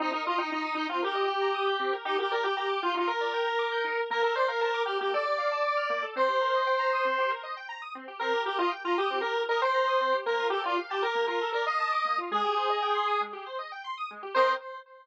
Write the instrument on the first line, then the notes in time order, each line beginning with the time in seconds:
lead 1 (square)
0.00 C4 D#4
0.12 D#4 A#4
0.26 F4 D#5
0.38 D#4 G5
0.51 D#4 A#5
0.65 D#6
0.75 D#4 G6
0.89 C4 F4
1.02 G4 A#4
1.15 D#5
1.28 G5
1.41 A#5
1.54 D#6
1.66 G6
1.79 C4
1.93 A#4
2.05 D#4 G4
2.18 G4 A#4
2.31 A#4 D5
2.43 G4 G5
2.57 G4 A#5
2.69 D6
2.82 F4 G6
2.94 D#4 F4
3.07 A#4
3.21 D5
3.34 G5
3.47 A#5
3.59 D6
3.72 G6
3.84 D#4
3.97 A#4
4.10 A#3 A#4
4.22 A4 A#4
4.35 C5 D5
4.48 A#4 F5
4.61 A#4 A5
4.74 D6
4.86 G4 F6
5.00 A#3 G4
5.13 A4 D5
5.25 D5
5.38 F5
5.51 A5
5.64 D6
5.77 F6
5.90 A#3
6.02 A4
6.16 C4 C5
6.28 G4
6.41 A#4
6.54 D#5
6.67 G5
6.79 A#5
6.93 D#6
7.05 C4
7.18 G4
7.30 A#4
7.43 D#5
7.57 G5
7.69 A#5
7.82 D#6
7.95 C4
8.08 G4
8.19 C4 A#4
8.33 G4
8.46 G4 A#4
8.59 F4 D#5
8.71 G5
8.85 F4 A#5
8.98 G4 D#6
9.10 C4
9.21 G4 A#4
9.36 A#4
9.49 A#4 D#5
9.62 C5 G5
9.74 A#5
9.87 D#6
10.01 C4
10.12 G4
10.26 A#3 A#4
10.39 F4
10.50 G4 A4
10.64 F4 D5
10.78 F5
10.90 G4 A5
11.02 A#4 D6
11.15 A#3
11.27 F4 A#4
11.41 A4
11.52 A#4 D5
11.66 D#5 F5
11.80 A5
11.92 D6
12.05 A#3
12.18 F4
12.31 G#3 G#4
12.44 G4
12.57 C5
12.70 D#5
12.82 G5
12.95 C6
13.08 D#6
13.21 G#3
13.33 G4
13.46 C5
13.59 D#5
13.72 G5
13.84 C6
13.97 D#6
14.11 G#3
14.23 G4
14.34 C4 A#4 C5 D#5 G5